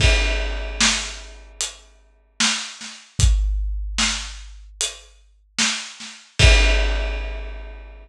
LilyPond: \new DrumStaff \drummode { \time 4/4 \tempo 4 = 75 <cymc bd>4 sn4 hh4 sn8 sn8 | <hh bd>4 sn4 hh4 sn8 sn8 | <cymc bd>4 r4 r4 r4 | }